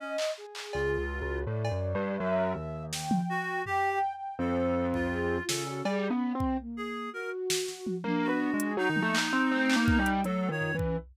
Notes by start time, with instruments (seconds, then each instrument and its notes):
0.00 clarinet C#4, flute D#5
0.18 clap
0.38 flute G#4
0.55 clap
0.73 acoustic grand piano C#2, clarinet F4, cowbell
0.98 acoustic grand piano C#2
1.10 flute F#4
1.22 acoustic grand piano C#2
1.47 acoustic grand piano A2, flute D5
1.65 cowbell
1.71 acoustic grand piano F#2
1.95 acoustic grand piano G2
2.17 acoustic grand piano F#2, flute E5
2.55 acoustic grand piano D#2
2.93 flute G5, snare
3.11 high tom
3.29 clarinet F#4
3.66 clarinet G4, flute G5, floor tom
3.91 flute G5
4.14 flute G5
4.39 acoustic grand piano F2, clarinet A4, flute C5
4.94 clarinet F4, kick
5.11 flute G#4
5.39 flute F4
5.48 acoustic grand piano C#3, clarinet A4, snare
5.66 flute F#4, cowbell
5.85 acoustic grand piano G3, flute G#4, cowbell
6.10 acoustic grand piano B3, flute C#4
6.35 acoustic grand piano C4, flute C4
6.40 kick
6.60 flute A#3
6.77 clarinet G#4
7.13 flute F#4, clarinet A#4
7.50 snare
7.68 snare
7.87 high tom
8.04 acoustic grand piano A#3, flute D4, high tom
8.24 clarinet F#4
8.28 acoustic grand piano B3
8.54 acoustic grand piano G#3
8.60 closed hi-hat
8.77 acoustic grand piano F#3, clarinet D#4
8.90 acoustic grand piano D#3
8.96 high tom
9.02 acoustic grand piano A3, flute A#3
9.15 clap
9.33 acoustic grand piano C4
9.50 flute A3, acoustic grand piano C4
9.70 clap
9.75 acoustic grand piano A#3, flute B3
9.88 kick
9.99 acoustic grand piano G3, flute D#4
10.06 closed hi-hat
10.24 acoustic grand piano F#3, flute A3, clarinet A4, closed hi-hat
10.48 acoustic grand piano D#3, flute F4, clarinet C#5
10.61 floor tom
10.73 acoustic grand piano E3, flute C#4
10.79 kick